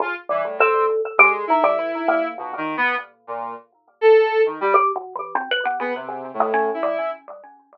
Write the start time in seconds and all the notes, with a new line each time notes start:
0.00 C#3 F4
0.29 E3 G3
0.45 A2
0.59 C4 A4
1.18 G#3 G4
1.47 D#4 E4
1.64 G3
1.79 E3
2.08 A#3
2.38 A#2 B2
2.57 D#3
2.77 B3
3.27 A#2
4.01 A4
4.46 D#3
4.61 G3
4.74 G4
4.96 B2
5.15 E3
5.35 C4
5.51 B4
5.65 B3
5.80 C#3 B3
5.95 C3
6.09 C#3
6.34 A2
6.40 G#3
6.54 C#4
6.74 E4
6.83 G3